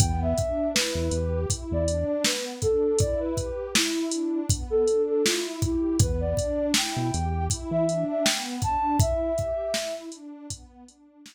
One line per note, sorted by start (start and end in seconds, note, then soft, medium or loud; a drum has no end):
0.00 0.34 E2 medium
0.00 0.34 B3 medium
0.00 0.20 G5 medium
0.00 kick medium
0.00 closed hi-hat medium
0.22 0.68 E5 medium
0.37 0.71 D4 medium
0.37 kick medium
0.37 closed hi-hat medium
0.74 1.10 E4 medium
0.74 1.40 B4 medium
0.74 snare medium
0.95 1.10 E2 medium
1.11 1.46 E2 medium
1.11 1.47 G4 medium
1.11 closed hi-hat medium
1.50 1.84 E4 medium
1.50 kick medium
1.50 closed hi-hat medium
1.71 2.05 E2 medium
1.71 2.06 D5 medium
1.88 2.22 D4 medium
1.88 closed hi-hat medium
2.07 2.23 D5 medium
2.25 2.59 B3 medium
2.25 2.45 B4 medium
2.25 snare medium
2.62 2.97 D4 medium
2.62 2.99 A4 medium
2.62 kick medium
2.62 closed hi-hat medium
2.99 3.34 E4 medium
2.99 3.20 D5 medium
2.99 kick medium
2.99 closed hi-hat medium
3.20 3.67 B4 medium
3.37 3.72 G4 medium
3.37 kick medium
3.37 closed hi-hat medium
3.75 4.09 E4 medium
3.75 4.39 E4 medium
3.75 snare medium
4.11 4.47 D4 medium
4.11 closed hi-hat medium
4.50 4.84 B3 medium
4.50 kick medium
4.50 closed hi-hat medium
4.70 5.02 A4 loud
4.88 5.22 D4 medium
4.88 closed hi-hat medium
5.08 5.24 A4 medium
5.24 5.59 E4 medium
5.24 5.43 F4 medium
5.24 snare medium
5.62 5.97 E4 medium
5.62 5.96 G4 medium
5.62 kick medium
5.62 closed hi-hat medium
6.00 6.35 E2 medium
6.00 6.34 B3 medium
6.00 6.21 B4 medium
6.00 kick loud
6.00 closed hi-hat medium
6.20 6.66 D5 medium
6.37 6.71 D4 medium
6.37 kick medium
6.37 closed hi-hat medium
6.74 7.10 E4 medium
6.74 7.45 G5 medium
6.74 snare medium
6.96 7.11 B2 medium
7.13 7.48 E2 medium
7.13 7.47 G4 medium
7.13 closed hi-hat medium
7.50 7.84 E4 medium
7.50 kick medium
7.50 closed hi-hat medium
7.71 8.05 E3 medium
7.71 8.03 E5 medium
7.88 8.22 D4 medium
7.88 closed hi-hat medium
8.10 8.25 E5 medium
8.24 8.60 B3 medium
8.24 8.44 G5 medium
8.24 snare medium
8.62 8.97 D4 medium
8.62 8.97 A5 medium
8.62 kick medium
8.62 closed hi-hat medium
8.99 9.34 E4 medium
8.99 9.94 E5 loud
8.99 kick loud
8.99 closed hi-hat medium
9.37 9.71 G4 medium
9.37 kick medium
9.37 closed hi-hat medium
9.74 10.09 E4 medium
9.74 snare medium
10.12 10.47 D4 medium
10.12 closed hi-hat medium
10.50 10.84 B3 medium
10.50 kick medium
10.50 closed hi-hat loud
10.87 11.21 D4 medium
10.87 closed hi-hat medium
11.25 11.35 E4 medium
11.25 snare medium